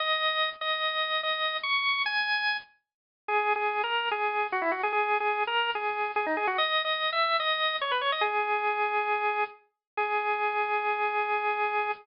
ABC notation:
X:1
M:4/4
L:1/16
Q:1/4=146
K:G#m
V:1 name="Drawbar Organ"
d6 d6 d4 | c'4 g6 z6 | (3G4 G4 A4 G4 F E F G | (3G4 G4 A4 G4 G D G F |
(3d4 d4 e4 d4 c B c d | "^rit." G12 z4 | G16 |]